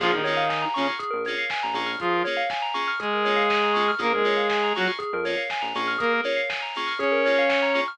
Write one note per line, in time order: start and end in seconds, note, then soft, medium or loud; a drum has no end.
0.00 0.22 A#1 medium
0.00 0.11 F3 medium
0.00 0.09 A#3 medium
0.00 0.09 C#4 medium
0.00 0.11 F4 medium
0.00 0.09 F4 medium
0.00 0.11 G#4 loud
0.00 0.09 G#4 medium
0.00 kick loud
0.00 crash loud
0.12 0.65 D#3 medium
0.12 0.65 D#4 medium
0.12 0.23 A#4 medium
0.24 0.44 A#3 medium
0.24 0.44 C#4 medium
0.24 0.44 F4 medium
0.24 0.44 G#4 medium
0.24 0.35 C#5 medium
0.24 open hi-hat medium
0.37 0.48 F5 medium
0.49 0.61 G#5 medium
0.49 kick medium
0.49 snare loud
0.62 0.73 A#5 medium
0.74 0.87 C#3 medium
0.74 0.94 A#3 medium
0.74 0.87 C#4 medium
0.74 0.94 C#4 medium
0.74 0.94 F4 medium
0.74 0.94 G#4 medium
0.74 0.85 C#6 medium
0.74 open hi-hat medium
0.88 0.99 F6 medium
0.99 1.11 G#4 medium
0.99 kick medium
0.99 closed hi-hat loud
1.11 1.36 A#1 medium
1.11 1.22 A#4 medium
1.25 1.44 A#3 medium
1.25 1.44 C#4 medium
1.25 1.44 F4 medium
1.25 1.44 G#4 medium
1.25 1.37 C#5 medium
1.25 open hi-hat medium
1.38 1.50 F5 medium
1.50 1.62 G#5 medium
1.50 kick medium
1.50 snare loud
1.63 1.74 A#1 medium
1.63 1.74 A#5 medium
1.74 1.97 A#1 medium
1.74 1.91 A#3 medium
1.74 1.91 C#4 medium
1.74 1.91 F4 medium
1.74 1.91 G#4 medium
1.74 1.87 C#6 medium
1.74 open hi-hat medium
1.86 1.98 F6 medium
2.00 2.23 F3 medium
2.00 2.23 F4 medium
2.00 2.12 G#4 medium
2.00 kick loud
2.00 closed hi-hat loud
2.12 2.24 A#4 medium
2.24 2.43 A#3 medium
2.24 2.43 C#4 medium
2.24 2.43 F4 medium
2.24 2.43 G#4 medium
2.24 2.36 C#5 medium
2.24 open hi-hat medium
2.37 2.48 F5 medium
2.50 2.62 G#5 medium
2.50 kick loud
2.50 snare loud
2.62 2.73 A#5 loud
2.74 2.91 A#3 medium
2.74 2.91 C#4 medium
2.74 2.91 F4 medium
2.74 2.91 G#4 medium
2.74 2.86 C#6 medium
2.74 open hi-hat medium
2.88 2.99 F6 medium
3.00 3.91 G#3 medium
3.00 3.11 G#4 medium
3.00 3.91 G#4 medium
3.00 kick medium
3.00 closed hi-hat loud
3.13 3.25 A#4 medium
3.25 3.43 A#3 medium
3.25 3.43 C#4 medium
3.25 3.43 F4 medium
3.25 3.43 G#4 medium
3.25 3.36 C#5 medium
3.25 open hi-hat medium
3.36 3.48 F5 medium
3.50 3.61 G#5 loud
3.50 kick medium
3.50 snare loud
3.63 3.75 A#5 medium
3.74 3.84 A#3 medium
3.74 3.84 C#4 medium
3.74 3.84 F4 medium
3.74 3.84 G#4 medium
3.74 3.85 C#6 medium
3.74 open hi-hat medium
3.88 3.99 F6 medium
3.98 4.22 A#1 medium
3.98 4.07 A#3 medium
3.98 4.13 A#3 medium
3.98 4.07 C#4 medium
3.98 4.07 F4 loud
3.98 4.07 G#4 medium
3.98 4.11 G#4 loud
3.98 4.13 A#4 medium
3.98 kick loud
3.98 closed hi-hat loud
4.13 4.73 G#3 medium
4.13 4.73 G#4 medium
4.13 4.25 A#4 medium
4.24 4.41 A#3 medium
4.24 4.41 C#4 medium
4.24 4.41 F4 medium
4.24 4.41 G#4 medium
4.24 4.37 C#5 medium
4.24 open hi-hat medium
4.37 4.48 F5 medium
4.50 4.62 G#5 medium
4.50 kick medium
4.50 snare loud
4.63 4.74 A#5 medium
4.75 4.88 F#3 medium
4.75 4.93 A#3 medium
4.75 4.93 C#4 medium
4.75 4.93 F4 medium
4.75 4.88 F#4 medium
4.75 4.93 G#4 medium
4.75 4.87 C#6 medium
4.75 open hi-hat medium
4.87 4.99 F6 medium
4.99 5.10 G#4 medium
4.99 kick medium
4.99 closed hi-hat loud
5.13 5.36 F2 medium
5.13 5.25 A#4 medium
5.25 5.42 A#3 medium
5.25 5.42 C#4 medium
5.25 5.42 F4 medium
5.25 5.42 G#4 medium
5.25 5.36 C#5 medium
5.25 open hi-hat medium
5.37 5.48 F5 medium
5.50 5.62 G#5 medium
5.50 kick medium
5.50 snare loud
5.62 5.73 A#1 medium
5.62 5.73 A#5 medium
5.75 5.97 A#1 medium
5.75 5.92 A#3 medium
5.75 5.92 C#4 medium
5.75 5.92 F4 medium
5.75 5.92 G#4 medium
5.75 5.87 C#6 medium
5.75 open hi-hat medium
5.88 5.99 F6 medium
5.98 6.21 A#3 medium
5.98 6.10 G#4 medium
5.98 6.21 A#4 medium
5.98 kick loud
5.98 closed hi-hat loud
6.13 6.25 A#4 medium
6.24 6.41 A#3 medium
6.24 6.41 C#4 medium
6.24 6.41 F4 medium
6.24 6.41 G#4 medium
6.24 6.36 C#5 medium
6.24 open hi-hat medium
6.37 6.48 F5 medium
6.50 6.61 G#5 medium
6.50 kick medium
6.50 snare loud
6.62 6.74 A#5 medium
6.75 6.93 A#3 medium
6.75 6.93 C#4 medium
6.75 6.93 F4 medium
6.75 6.93 G#4 medium
6.75 6.88 C#6 medium
6.75 open hi-hat medium
6.87 6.98 F6 medium
6.98 7.80 C#4 medium
6.98 7.11 G#4 medium
6.98 7.80 C#5 medium
6.98 kick medium
6.98 closed hi-hat medium
7.12 7.23 A#4 medium
7.25 7.43 A#3 medium
7.25 7.43 C#4 medium
7.25 7.43 F4 medium
7.25 7.43 G#4 medium
7.25 7.37 C#5 medium
7.25 open hi-hat medium
7.39 7.50 F5 medium
7.49 7.61 G#5 medium
7.49 kick medium
7.49 snare loud
7.62 7.74 A#5 medium
7.74 7.83 A#3 medium
7.74 7.83 C#4 medium
7.74 7.83 F4 medium
7.74 7.83 G#4 medium
7.74 7.86 C#6 medium
7.74 open hi-hat medium
7.88 7.98 F6 medium